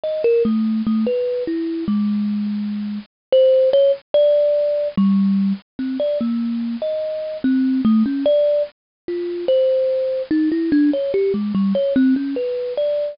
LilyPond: \new Staff { \time 3/4 \partial 4 \tempo 4 = 73 ees''16 bes'16 a8 | a16 b'8 e'8 aes4. r16 | c''8 des''16 r16 d''4 g8. r16 | c'16 d''16 bes8. ees''8. c'8 a16 des'16 |
d''8 r8 f'8 c''4 ees'16 e'16 | d'16 des''16 g'16 aes16 g16 des''16 c'16 des'16 b'8 d''8 | }